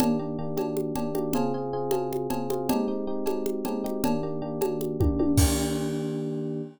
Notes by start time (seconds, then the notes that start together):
0.00 D#3 A#3 D4 G4, cowbell, low conga
0.19 D#3 A#3 D4 G4
0.39 D#3 A#3 D4 G4
0.57 D#3 A#3 D4 G4, cowbell, high conga
0.77 high conga
0.96 D#3 A#3 D4 G4, cowbell, low conga
1.15 D#3 A#3 D4 G4, high conga
1.33 C#3 C4 F4 G#4, cowbell, low conga
1.54 C#3 C4 F4 G#4
1.73 C#3 C4 F4 G#4
1.91 C#3 C4 F4 G#4, cowbell, high conga
2.13 high conga
2.30 C#3 C4 F4 G#4, cowbell, low conga
2.50 C#3 C4 F4 G#4, high conga
2.69 G#3 C4 D#4 G4, cowbell, low conga
2.88 G#3 C4 D#4 G4
3.07 G#3 C4 D#4 G4
3.26 G#3 C4 D#4 G4, cowbell, high conga
3.46 high conga
3.65 G#3 C4 D#4 G4, cowbell, low conga
3.84 G#3 C4 D#4 G4, high conga
4.04 D#3 A#3 D4 G4, cowbell, low conga
4.23 D#3 A#3 D4 G4
4.42 D#3 A#3 D4 G4
4.61 D#3 A#3 D4 G4, cowbell, high conga
4.81 high conga
5.00 D#3 A#3 D4 G4, kick, high tom
5.19 D#3 A#3 D4 G4, high tom
5.37 D#3 A#3 D4 G4, kick, crash